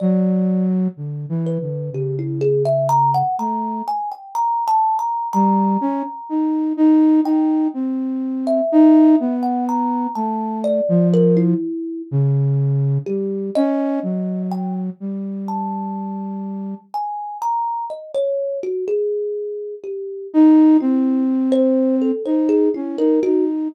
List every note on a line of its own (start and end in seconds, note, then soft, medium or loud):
0.00 0.88 F#3 loud
0.00 0.65 D5 soft
0.97 1.26 D3 soft
1.29 1.58 E3 medium
1.46 1.90 B4 medium
1.61 1.90 D3 medium
1.92 3.23 C#3 medium
1.92 2.16 G4 medium
2.19 2.41 E4 medium
2.41 2.63 G#4 loud
2.65 2.87 E5 medium
2.89 3.11 A#5 loud
3.14 3.36 F#5 medium
3.39 3.82 A3 medium
3.39 3.83 A#5 medium
3.88 4.09 G#5 medium
4.11 4.33 G5 medium
4.35 4.64 A#5 loud
4.68 4.97 A5 loud
4.99 5.28 A#5 medium
5.33 5.77 G3 medium
5.33 6.64 A#5 loud
5.81 6.03 C#4 medium
6.29 6.73 D#4 medium
6.77 7.21 D#4 loud
7.24 7.68 D#4 medium
7.24 7.69 G5 medium
7.74 8.61 C4 medium
8.47 9.34 E5 medium
8.72 9.16 D#4 loud
9.20 10.07 B3 medium
9.43 9.65 F#5 medium
9.69 10.12 A#5 medium
10.15 10.81 A3 medium
10.15 10.59 A5 medium
10.64 11.08 D5 medium
10.89 11.54 F3 loud
11.14 11.35 A#4 loud
11.37 12.02 E4 medium
12.11 12.98 C#3 loud
13.06 13.50 G3 soft
13.06 13.50 G4 medium
13.55 14.00 C#4 loud
13.55 14.43 D#5 loud
14.03 14.90 F#3 medium
14.51 14.73 G5 medium
15.00 16.74 G3 medium
15.48 16.79 A5 medium
16.94 17.38 G#5 medium
17.42 17.85 A#5 medium
17.90 18.12 D#5 medium
18.15 18.58 C#5 medium
18.63 18.85 F#4 medium
18.88 19.75 G#4 medium
19.84 20.27 G4 medium
20.34 20.77 D#4 loud
20.80 22.11 C4 medium
20.80 21.24 E4 medium
21.52 21.96 C5 loud
22.02 22.23 A4 medium
22.25 22.69 D#4 medium
22.25 22.47 C5 medium
22.49 22.71 G#4 medium
22.74 22.97 C#4 medium
22.74 22.96 E4 medium
22.98 23.20 D#4 medium
22.98 23.20 A#4 medium
23.23 23.68 D#4 medium
23.23 23.45 F#4 loud